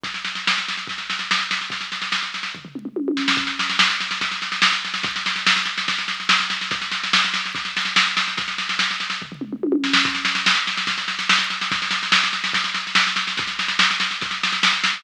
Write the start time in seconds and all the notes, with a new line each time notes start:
0.03 kick, snare
0.14 snare
0.25 snare
0.35 snare
0.47 snare
0.58 snare
0.68 snare
0.77 snare
0.87 kick, snare
0.98 snare
1.10 snare
1.19 snare
1.31 snare
1.39 snare
1.51 snare
1.61 snare
1.70 kick, snare
1.81 snare
1.92 snare
2.02 snare
2.12 snare
2.22 snare
2.34 snare
2.43 snare
2.55 kick, floor tom
2.65 floor tom
2.75 mid tom
2.85 mid tom
2.96 high tom
3.08 high tom
3.17 snare
3.28 snare
3.37 kick, snare
3.47 snare
3.59 snare
3.69 snare
3.79 snare
3.90 snare
4.00 snare
4.11 snare
4.21 kick, snare
4.31 snare
4.42 snare
4.52 snare
4.62 snare
4.72 snare
4.85 snare
4.94 snare
5.03 kick, snare
5.16 snare
5.26 snare
5.36 snare
5.46 snare
5.56 snare
5.65 snare
5.78 snare
5.88 kick, snare
5.98 snare
6.08 snare
6.20 snare
6.29 snare
6.40 snare
6.50 snare
6.61 snare
6.71 kick, snare
6.81 snare
6.91 snare
7.03 snare
7.13 snare
7.24 snare
7.34 snare
7.45 snare
7.55 kick, snare
7.65 snare
7.77 snare
7.85 snare
7.96 snare
8.07 snare
8.17 snare
8.28 snare
8.37 kick, snare
8.48 snare
8.58 snare
8.69 snare
8.79 snare
8.91 snare
9.00 snare
9.10 snare
9.22 kick, floor tom
9.32 floor tom
9.41 mid tom
9.53 mid tom
9.63 high tom
9.72 high tom
9.84 snare
9.93 snare
10.05 kick, snare
10.15 snare
10.25 snare
10.35 snare
10.46 snare
10.55 snare
10.67 snare
10.77 snare
10.87 kick, snare
10.98 snare
11.08 snare
11.19 snare
11.29 snare
11.38 snare
11.50 snare
11.61 snare
11.71 kick, snare
11.82 snare
11.91 snare
12.03 snare
12.12 snare
12.23 snare
12.33 snare
12.44 snare
12.53 kick, snare
12.64 snare
12.74 snare
12.87 snare
12.95 snare
13.07 snare
13.16 snare
13.27 snare
13.37 kick, snare
13.47 snare
13.59 snare
13.68 snare
13.79 snare
13.91 snare
14.00 snare
14.11 snare
14.21 kick, snare
14.31 snare
14.43 snare
14.52 snare
14.63 snare
14.73 snare
14.84 snare
14.93 snare